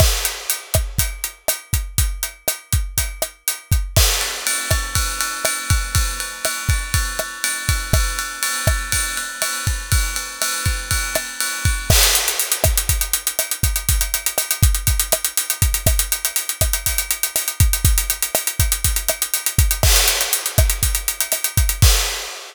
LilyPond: \new DrumStaff \drummode { \time 4/4 \tempo 4 = 121 <cymc bd ss>8 hh8 hh8 <hh bd ss>8 <hh bd>8 hh8 <hh ss>8 <hh bd>8 | <hh bd>8 hh8 <hh ss>8 <hh bd>8 <hh bd>8 <hh ss>8 hh8 <hh bd>8 | <cymc bd ss>8 cymr8 cymr8 <bd cymr ss>8 <bd cymr>8 cymr8 <cymr ss>8 <bd cymr>8 | <bd cymr>8 cymr8 <cymr ss>8 <bd cymr>8 <bd cymr>8 <cymr ss>8 cymr8 <bd cymr>8 |
<bd cymr ss>8 cymr8 cymr8 <bd cymr ss>8 <bd cymr>8 cymr8 <cymr ss>8 <bd cymr>8 | <bd cymr>8 cymr8 <cymr ss>8 <bd cymr>8 <bd cymr>8 <cymr ss>8 cymr8 <bd cymr>8 | <cymc bd ss>16 hh16 hh16 hh16 hh16 hh16 <hh bd ss>16 hh16 <hh bd>16 hh16 hh16 hh16 <hh ss>16 hh16 <hh bd>16 hh16 | <hh bd>16 hh16 hh16 hh16 <hh ss>16 hh16 <hh bd>16 hh16 <hh bd>16 hh16 <hh ss>16 hh16 hh16 hh16 <hh bd>16 hh16 |
<hh bd ss>16 hh16 hh16 hh16 hh16 hh16 <hh bd ss>16 hh16 <hh bd>16 hh16 hh16 hh16 <hh ss>16 hh16 <hh bd>16 hh16 | <hh bd>16 hh16 hh16 hh16 <hh ss>16 hh16 <hh bd>16 hh16 <hh bd>16 hh16 <hh ss>16 hh16 hh16 hh16 <hh bd>16 hh16 | <cymc bd ss>16 hh16 hh16 hh16 hh16 hh16 <hh bd ss>16 hh16 <hh bd>16 hh16 hh16 hh16 <hh ss>16 hh16 <hh bd>16 hh16 | <cymc bd>4 r4 r4 r4 | }